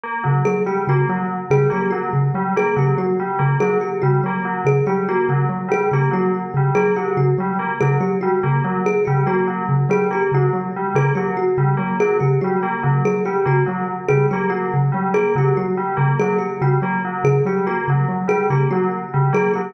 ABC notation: X:1
M:2/4
L:1/8
Q:1/4=143
K:none
V:1 name="Xylophone" clef=bass
z ^C, | ^F, z ^C, F, | z ^C, ^F, z | ^C, ^F, z C, |
^F, z ^C, F, | z ^C, ^F, z | ^C, ^F, z C, | ^F, z ^C, F, |
z ^C, ^F, z | ^C, ^F, z C, | ^F, z ^C, F, | z ^C, ^F, z |
^C, ^F, z C, | ^F, z ^C, F, | z ^C, ^F, z | ^C, ^F, z C, |
^F, z ^C, F, | z ^C, ^F, z | ^C, ^F, z C, | ^F, z ^C, F, |
z ^C, ^F, z | ^C, ^F, z C, | ^F, z ^C, F, | z ^C, ^F, z |]
V:2 name="Tubular Bells"
^A, ^F, | z G, ^A, ^F, | z G, ^A, ^F, | z G, ^A, ^F, |
z G, ^A, ^F, | z G, ^A, ^F, | z G, ^A, ^F, | z G, ^A, ^F, |
z G, ^A, ^F, | z G, ^A, ^F, | z G, ^A, ^F, | z G, ^A, ^F, |
z G, ^A, ^F, | z G, ^A, ^F, | z G, ^A, ^F, | z G, ^A, ^F, |
z G, ^A, ^F, | z G, ^A, ^F, | z G, ^A, ^F, | z G, ^A, ^F, |
z G, ^A, ^F, | z G, ^A, ^F, | z G, ^A, ^F, | z G, ^A, ^F, |]
V:3 name="Kalimba"
z2 | ^G =G ^F z | z ^G =G ^F | z2 ^G =G |
^F z2 ^G | G ^F z2 | ^G =G ^F z | z ^G =G ^F |
z2 ^G =G | ^F z2 ^G | G ^F z2 | ^G =G ^F z |
z ^G =G ^F | z2 ^G =G | ^F z2 ^G | G ^F z2 |
^G =G ^F z | z ^G =G ^F | z2 ^G =G | ^F z2 ^G |
G ^F z2 | ^G =G ^F z | z ^G =G ^F | z2 ^G =G |]